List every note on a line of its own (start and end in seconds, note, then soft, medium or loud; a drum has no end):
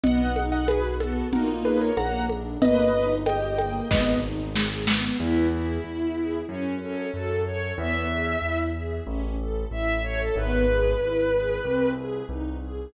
0.03 1.22 B1 medium
0.03 0.33 B3 medium
0.03 0.43 D#5 loud
0.03 0.43 F#5 loud
0.03 low conga medium
0.36 0.65 D#4 medium
0.36 high conga medium
0.52 0.67 D#5 medium
0.52 0.67 F#5 loud
0.68 0.97 F#4 medium
0.68 0.94 G#4 loud
0.68 0.94 B4 loud
0.68 high conga medium
1.00 1.29 B3 medium
1.00 1.28 F#4 medium
1.00 1.28 A4 loud
1.00 high conga medium
1.32 1.92 A#1 medium
1.32 1.91 A#3 medium
1.32 1.91 D#4 loud
1.32 1.91 F4 medium
1.32 1.48 F#4 medium
1.32 1.48 A#4 medium
1.32 low conga medium
1.65 1.80 G#4 medium
1.65 1.80 B4 loud
1.65 high conga medium
1.81 1.97 A#4 medium
1.81 1.97 C#5 loud
1.97 2.56 A#1 medium
1.97 2.26 A#3 medium
1.97 2.26 F#5 medium
1.97 2.26 A#5 loud
1.97 high conga medium
2.29 2.58 D4 medium
2.29 high conga medium
2.62 3.80 G1 loud
2.62 2.91 A#3 medium
2.62 3.15 B4 loud
2.62 3.15 D#5 loud
2.62 low conga medium
2.94 3.23 D#4 medium
3.26 3.55 G4 medium
3.26 3.58 D#5 medium
3.26 3.58 G5 loud
3.26 high conga medium
3.58 3.87 A#3 medium
3.58 3.89 D#5 medium
3.58 3.89 G5 medium
3.58 high conga medium
3.90 5.09 G#1 loud
3.90 4.20 B3 medium
3.90 4.19 B4 medium
3.90 4.19 D#5 loud
3.90 kick medium
3.90 snare medium
4.23 4.52 D#4 medium
4.55 4.84 G#4 medium
4.55 snare medium
4.87 5.17 B3 medium
4.87 snare medium
5.20 5.78 E2 loud
5.20 5.49 B3 medium
5.20 5.47 E4 medium
5.52 6.38 E4 medium
5.52 5.81 G#4 medium
5.84 6.42 E2 medium
5.84 6.13 E4 medium
6.17 6.46 G#4 medium
6.49 7.07 F#2 loud
6.49 6.75 C#4 medium
6.49 6.78 C#4 medium
6.81 7.11 C#4 medium
6.81 7.10 A4 medium
7.13 7.72 F#2 medium
7.13 7.42 F#4 medium
7.13 7.42 A4 medium
7.46 7.75 A4 medium
7.46 7.73 C#5 medium
7.78 8.36 E2 loud
7.78 8.07 B3 medium
7.78 8.59 E5 medium
8.10 8.39 G#4 medium
8.42 9.00 E2 medium
8.42 8.71 E4 medium
8.75 9.04 G#4 medium
9.07 9.65 A1 loud
9.07 9.36 C#4 medium
9.39 9.68 A4 medium
9.71 10.29 A1 medium
9.71 10.00 E4 medium
9.71 10.03 E5 medium
10.04 10.33 A4 medium
10.04 10.19 C#5 loud
10.20 10.35 A4 medium
10.36 10.94 G#1 loud
10.36 10.65 B3 medium
10.36 11.90 B4 medium
10.68 10.97 G#4 medium
11.00 11.59 G#1 medium
11.00 11.29 E4 medium
11.33 11.62 G#4 medium
11.65 12.23 C2 loud
11.65 11.94 C4 medium
11.97 12.26 G#4 medium
12.29 12.87 C2 medium
12.29 12.58 D#4 medium
12.62 12.91 G#4 medium